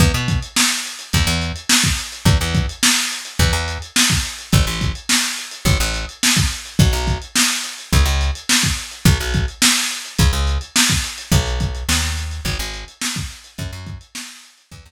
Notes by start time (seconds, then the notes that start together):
0.00 E2, kick, closed hi-hat
0.14 B2, closed hi-hat
0.28 kick, closed hi-hat
0.42 closed hi-hat
0.56 snare
0.71 closed hi-hat
0.85 closed hi-hat
0.99 closed hi-hat
1.13 E2, kick, closed hi-hat
1.27 E2, closed hi-hat
1.41 closed hi-hat
1.56 closed hi-hat
1.69 snare
1.84 kick, closed hi-hat
1.98 closed hi-hat
2.12 closed hi-hat
2.25 E2, kick, closed hi-hat
2.41 E2, closed hi-hat
2.55 kick, closed hi-hat
2.69 closed hi-hat
2.83 snare
2.97 closed hi-hat
3.12 closed hi-hat
3.25 closed hi-hat
3.39 E2, kick, closed hi-hat
3.53 E2, closed hi-hat
3.68 closed hi-hat
3.82 closed hi-hat
3.96 snare
4.10 kick, closed hi-hat
4.25 closed hi-hat
4.39 closed hi-hat
4.52 A1, kick, closed hi-hat
4.67 A1, closed hi-hat
4.81 kick, closed hi-hat
4.95 closed hi-hat
5.09 snare
5.23 closed hi-hat
5.38 closed hi-hat
5.51 closed hi-hat
5.65 A1, kick, closed hi-hat
5.80 A1, closed hi-hat
5.94 closed hi-hat
6.09 closed hi-hat
6.23 snare
6.37 kick, closed hi-hat
6.51 closed hi-hat
6.65 closed hi-hat
6.79 B1, kick, closed hi-hat
6.93 B1, closed hi-hat
7.07 kick, closed hi-hat
7.22 closed hi-hat
7.35 snare
7.50 closed hi-hat
7.64 closed hi-hat
7.78 closed hi-hat
7.93 C#2, kick, closed hi-hat
8.05 C#2, closed hi-hat
8.21 closed hi-hat
8.35 closed hi-hat
8.49 snare
8.63 kick, closed hi-hat
8.77 closed hi-hat
8.91 closed hi-hat
9.05 B1, kick, closed hi-hat
9.20 B1, closed hi-hat
9.34 kick, closed hi-hat
9.48 closed hi-hat
9.62 snare
9.76 closed hi-hat
9.91 closed hi-hat
10.05 closed hi-hat
10.19 C#2, kick, closed hi-hat
10.33 C#2, closed hi-hat
10.47 closed hi-hat
10.61 closed hi-hat
10.76 snare
10.89 kick, closed hi-hat
11.04 closed hi-hat
11.18 closed hi-hat
11.32 B1, kick, closed hi-hat
11.46 closed hi-hat
11.60 kick, closed hi-hat
11.75 closed hi-hat
11.89 D#2, snare
12.03 closed hi-hat
12.17 closed hi-hat
12.31 closed hi-hat
12.45 G#1, kick, closed hi-hat
12.59 G#1, closed hi-hat
12.74 closed hi-hat
12.88 closed hi-hat
13.02 snare
13.16 kick, closed hi-hat
13.31 closed hi-hat
13.44 closed hi-hat
13.58 F#2, kick, closed hi-hat
13.73 F#2, closed hi-hat
13.87 kick, closed hi-hat
14.01 closed hi-hat
14.15 snare
14.29 closed hi-hat
14.44 closed hi-hat
14.58 closed hi-hat
14.71 E2, kick, closed hi-hat
14.85 E2, closed hi-hat